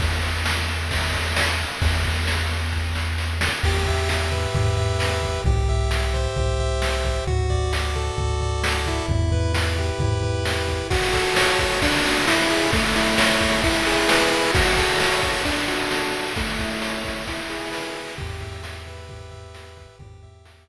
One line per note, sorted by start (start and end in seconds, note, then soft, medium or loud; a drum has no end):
0.00 1.65 E2 medium
0.00 kick medium
0.00 crash medium
0.23 ride medium
0.45 snare loud
0.68 ride medium
0.91 kick medium
0.91 ride medium
1.14 kick medium
1.14 ride medium
1.36 snare loud
1.59 ride medium
1.82 3.49 E2 medium
1.82 kick medium
1.82 ride medium
2.04 kick medium
2.04 ride medium
2.27 snare medium
2.50 ride medium
2.73 kick medium
2.95 snare medium
3.18 snare medium
3.41 snare loud
3.63 4.47 E2 medium
3.63 4.09 G4 medium
3.63 kick medium
3.63 crash medium
3.86 4.76 E5 medium
3.86 kick medium
3.86 floor tom medium
4.09 4.55 G4 medium
4.09 snare medium
4.32 4.98 B4 medium
4.32 floor tom medium
4.55 5.39 E2 medium
4.55 5.22 G4 medium
4.55 kick medium
4.55 floor tom medium
4.77 5.41 E5 medium
4.77 floor tom medium
4.99 5.42 B4 medium
4.99 snare medium
5.23 5.44 G4 medium
5.23 kick medium
5.23 snare soft
5.23 floor tom medium
5.44 6.28 C2 medium
5.44 5.90 G4 medium
5.44 kick medium
5.44 floor tom medium
5.68 6.59 E5 medium
5.68 floor tom medium
5.91 6.37 G4 medium
5.91 snare medium
6.14 6.81 C5 medium
6.14 floor tom medium
6.36 7.21 C2 medium
6.36 7.04 G4 medium
6.36 kick medium
6.36 floor tom medium
6.59 7.24 E5 medium
6.59 floor tom medium
6.81 7.25 C5 medium
6.81 snare medium
7.05 7.26 G4 medium
7.05 kick medium
7.05 snare soft
7.05 floor tom medium
7.27 8.11 D2 medium
7.27 7.73 F#4 medium
7.27 floor tom medium
7.50 8.41 D5 medium
7.50 kick medium
7.50 floor tom medium
7.73 8.17 F#4 medium
7.73 snare medium
7.95 8.63 A4 medium
7.95 floor tom medium
8.17 9.02 D2 medium
8.17 9.04 F#4 medium
8.17 kick medium
8.17 floor tom medium
8.41 9.06 D5 medium
8.41 floor tom medium
8.63 9.06 A4 medium
8.63 snare loud
8.86 9.53 E4 medium
8.86 kick medium
8.86 snare soft
8.86 floor tom medium
9.08 9.92 E2 medium
9.08 kick medium
9.08 floor tom medium
9.32 10.22 B4 medium
9.32 kick medium
9.32 floor tom medium
9.53 9.99 E4 medium
9.53 snare medium
9.77 10.44 G4 medium
9.77 floor tom medium
9.99 10.82 E2 medium
9.99 10.68 E4 medium
9.99 kick medium
9.99 floor tom medium
10.23 10.87 B4 medium
10.23 floor tom medium
10.45 10.88 G4 medium
10.45 snare medium
10.68 10.90 E4 medium
10.68 kick medium
10.68 snare soft
10.68 floor tom soft
10.90 11.60 F#4 loud
10.90 kick loud
10.90 crash medium
11.02 ride medium
11.13 11.78 A4 medium
11.13 kick medium
11.13 ride medium
11.25 ride medium
11.36 11.80 C#5 medium
11.36 snare loud
11.48 ride medium
11.59 11.82 F#4 medium
11.59 kick medium
11.59 ride medium
11.71 ride medium
11.82 12.26 D4 loud
11.82 kick medium
11.82 ride loud
11.93 ride medium
12.04 12.26 F#4 medium
12.04 snare soft
12.04 ride medium
12.16 ride medium
12.27 12.71 E4 loud
12.27 snare loud
12.39 ride medium
12.50 12.71 G#4 medium
12.50 ride medium
12.61 ride medium
12.73 13.41 A3 loud
12.73 kick medium
12.73 ride medium
12.84 ride medium
12.95 13.61 E4 medium
12.95 ride medium
13.07 ride medium
13.18 13.61 C#5 medium
13.18 snare loud
13.29 ride medium
13.41 13.63 A3 medium
13.41 kick medium
13.41 ride medium
13.52 ride medium
13.64 14.30 E4 loud
13.64 kick medium
13.64 ride medium
13.75 ride medium
13.86 14.51 G#4 medium
13.86 snare medium
13.86 ride medium
13.98 ride medium
14.08 14.51 B4 medium
14.08 snare loud
14.20 ride medium
14.31 14.52 E4 medium
14.31 ride medium
14.43 ride medium
14.54 15.23 F#4 loud
14.54 kick loud
14.54 ride loud
14.66 ride medium
14.77 15.42 A4 medium
14.77 kick medium
14.77 ride medium
14.89 ride medium
15.00 15.44 C#5 medium
15.00 snare loud
15.11 ride medium
15.23 15.45 F#4 medium
15.23 kick medium
15.23 ride medium
15.34 ride medium
15.45 16.12 D4 loud
15.45 kick medium
15.45 ride medium
15.57 ride medium
15.68 16.33 F#4 medium
15.68 snare medium
15.68 ride medium
15.79 ride medium
15.91 16.34 A4 medium
15.91 snare loud
16.02 ride medium
16.12 16.34 D4 medium
16.12 ride medium
16.25 ride medium
16.36 17.04 A3 loud
16.36 kick loud
16.36 ride medium
16.48 ride medium
16.58 17.23 E4 medium
16.58 kick medium
16.58 ride medium
16.70 ride medium
16.82 17.25 C#5 medium
16.82 snare loud
16.93 ride medium
17.04 17.26 A3 medium
17.04 kick medium
17.04 ride medium
17.16 ride medium
17.27 17.95 E4 loud
17.27 kick medium
17.27 ride loud
17.39 ride medium
17.50 18.14 G#4 medium
17.50 snare medium
17.50 ride medium
17.61 ride medium
17.71 18.15 B4 medium
17.71 snare loud
17.84 ride medium
17.96 18.17 E4 medium
17.96 ride medium
18.07 ride medium
18.18 19.87 E2 medium
18.18 18.63 G4 medium
18.18 kick medium
18.18 floor tom loud
18.41 19.31 E5 medium
18.41 kick medium
18.41 floor tom medium
18.63 19.09 G4 medium
18.63 snare loud
18.86 19.55 B4 medium
18.86 floor tom medium
19.09 19.77 G4 medium
19.09 kick medium
19.09 floor tom medium
19.31 19.96 E5 medium
19.31 floor tom medium
19.55 19.98 B4 medium
19.55 snare medium
19.77 19.99 G4 medium
19.77 kick medium
19.77 snare medium
19.77 floor tom medium
19.99 20.68 E2 loud
19.99 20.46 G4 medium
19.99 kick loud
19.99 floor tom loud
20.23 20.68 E5 medium
20.23 kick medium
20.23 floor tom medium
20.45 20.68 G4 medium
20.45 snare loud
20.67 20.68 B4 medium